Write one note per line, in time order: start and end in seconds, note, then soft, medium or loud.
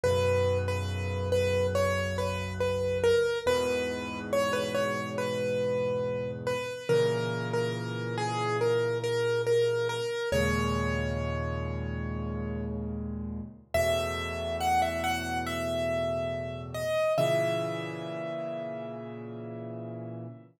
0.04 3.12 B1 medium
0.04 3.12 F#2 medium
0.04 3.12 C#3 medium
0.04 0.58 B4 medium
0.68 1.29 B4 medium
1.32 1.67 B4 medium
1.75 2.17 C#5 medium
2.18 2.53 B4 medium
2.61 2.98 B4 medium
3.04 3.39 A#4 medium
3.46 6.55 E2 medium
3.46 6.55 G#2 medium
3.46 6.55 B2 medium
3.46 4.19 B4 loud
4.33 4.53 C#5 medium
4.53 4.73 B4 medium
4.75 5.09 C#5 medium
5.18 6.31 B4 medium
6.47 6.88 B4 medium
6.89 9.98 A#2 medium
6.89 9.98 C#3 medium
6.89 9.98 E3 medium
6.89 7.49 A#4 medium
7.53 8.16 A#4 medium
8.18 8.57 G#4 medium
8.61 8.98 A#4 medium
9.04 9.42 A#4 medium
9.47 9.88 A#4 medium
9.89 10.29 A#4 medium
10.32 13.41 D#2 medium
10.32 13.41 A#2 medium
10.32 13.41 C#3 medium
10.32 13.41 G#3 medium
10.32 12.65 C#5 medium
13.74 16.84 E2 medium
13.74 16.84 A2 medium
13.74 16.84 B2 medium
13.74 14.56 E5 loud
14.61 14.81 F#5 medium
14.82 15.03 E5 medium
15.04 15.38 F#5 medium
15.47 16.62 E5 medium
16.74 17.13 D#5 medium
17.18 20.26 A#2 medium
17.18 20.26 C#3 medium
17.18 20.26 E3 medium
17.18 20.44 E5 medium